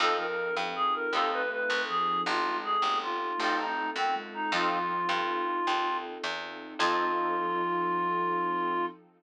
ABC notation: X:1
M:12/8
L:1/8
Q:3/8=106
K:F
V:1 name="Clarinet"
A B2 z _A B =A =B B2 _A2 | F2 _A2 F3 _E2 C z E | F9 z3 | F12 |]
V:2 name="Ocarina"
z F,2 F, z2 A,4 F,2 | z ^G,2 A, z2 A,4 _A,2 | F,4 z8 | F,12 |]
V:3 name="Acoustic Guitar (steel)"
[C_EFA]6 [CEFA]6- | [C_EFA]6 [CEFA]6 | [C_EFA]12 | [C_EFA]12 |]
V:4 name="Electric Bass (finger)" clef=bass
F,,3 G,,3 _E,,3 C,,3 | A,,,3 G,,,3 A,,,3 _G,,3 | F,,3 G,,3 _E,,3 =E,,3 | F,,12 |]
V:5 name="String Ensemble 1"
[C_EFA]12- | [C_EFA]12 | [C_EFA]12 | [C_EFA]12 |]